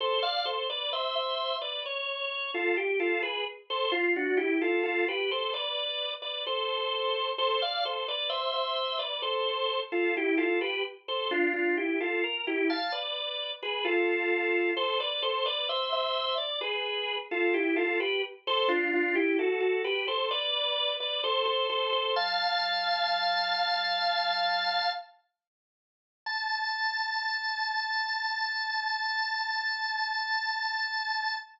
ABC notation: X:1
M:4/4
L:1/16
Q:1/4=65
K:Am
V:1 name="Drawbar Organ"
[Ac] [df] [Ac] [Bd] [ce] [ce]2 [Bd] _d3 [FA] G [FA] [^GB] z | [Ac] ^E [D^F] [=EG] [=FA] [FA] [GB] [Ac] [Bd]3 [Bd] [Ac]4 | [Ac] [df] [Ac] [Bd] [ce] [ce]2 [Bd] [Ac]3 [FA] [EG] [FA] [GB] z | [Ac] [DF] [DF] [EG] [FA] _B [EG] [fa] [=Bd]3 [^GB] [FA]4 |
[Ac] [Bd] [Ac] [Bd] [ce] [ce]2 d [^GB]3 [FA] [E=G] [FA] [GB] z | [Ac] [DF] [DF] [EG] [^FA] [FA] [GB] [Ac] [Bd]3 [Bd] [Ac] [Ac] [Ac] [Ac] | "^rit." [fa]12 z4 | a16 |]